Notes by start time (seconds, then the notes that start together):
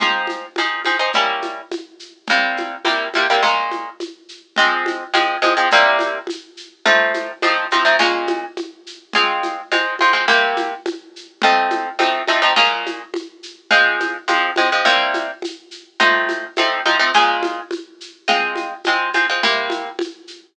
0.00 F3 C4 D#4 G#4, low conga, shaker
0.27 high conga, shaker
0.56 F3 C4 D#4 G#4, high conga, shaker
0.85 F3 C4 D#4 G#4, high conga, shaker
0.99 F3 C4 D#4 G#4
1.13 G3 A#3 C#4 E4, low conga, shaker
1.42 high conga, shaker
1.72 high conga, shaker
1.99 shaker
2.27 C3 G3 A#3 E4, low conga, shaker
2.57 high conga, shaker
2.85 C3 G3 A#3 E4, high conga, shaker
3.13 C3 G3 A#3 E4, high conga, shaker
3.30 C3 G3 A#3 E4
3.43 A#2 G#3 C#4 F4, low conga, shaker
3.71 high conga, shaker
4.00 high conga, shaker
4.29 shaker
4.56 F3 G#3 C4, low conga, shaker
4.86 high conga, shaker
5.14 F3 G#3 C4, high conga, shaker
5.42 F3 G#3 C4, high conga, shaker
5.57 F3 G#3 C4
5.71 C3 G3 A#3 E4, low conga, shaker
5.99 high conga, shaker
6.27 high conga, shaker
6.57 shaker
6.85 F3 A3 C4 D#4, low conga, shaker
7.14 high conga, shaker
7.42 F3 A3 C4 D#4, high conga, shaker
7.71 F3 A3 C4 D#4, high conga, shaker
7.85 F3 A3 C4 D#4
7.99 A#2 G#3 C#4 F4, low conga, shaker
8.27 high conga, shaker
8.57 high conga, shaker
8.87 shaker
9.13 G#3 C4 F4, low conga, shaker
9.43 high conga, shaker
9.72 G#3 C4 F4, high conga, shaker
9.99 G#3 C4 F4, high conga, shaker
10.13 G#3 C4 F4
10.28 C3 A#3 E4 G4, low conga, shaker
10.57 high conga, shaker
10.86 high conga, shaker
11.16 shaker
11.42 F3 A3 C4 D#4, low conga, shaker
11.70 high conga, shaker
11.99 F3 A3 C4 D#4, high conga, shaker
12.28 F3 A3 C4 D#4, high conga, shaker
12.42 F3 A3 C4 D#4
12.56 A#2 G#3 C#4 F4, low conga, shaker
12.86 high conga, shaker
13.14 high conga, shaker
13.43 shaker
13.71 F3 G#3 C4, low conga, shaker
14.00 high conga, shaker
14.28 F3 G#3 C4, high conga, shaker
14.56 F3 G#3 C4, high conga, shaker
14.72 F3 G#3 C4
14.85 C3 G3 A#3 E4, low conga, shaker
15.14 high conga, shaker
15.42 high conga, shaker
15.71 shaker
16.00 F3 A3 C4 D#4, low conga, shaker
16.29 high conga, shaker
16.56 F3 A3 C4 D#4, high conga, shaker
16.85 F3 A3 C4 D#4, high conga, shaker
16.99 F3 A3 C4 D#4
17.13 A#2 G#3 C#4 F4, low conga, shaker
17.43 high conga, shaker
17.71 high conga, shaker
18.01 shaker
18.28 G#3 C4 F4, low conga, shaker
18.56 high conga, shaker
18.84 G#3 C4 F4, high conga, shaker
19.13 G#3 C4 F4, high conga, shaker
19.30 G#3 C4 F4
19.43 C3 A#3 E4 G4, low conga, shaker
19.70 high conga, shaker
19.99 high conga, shaker
20.27 shaker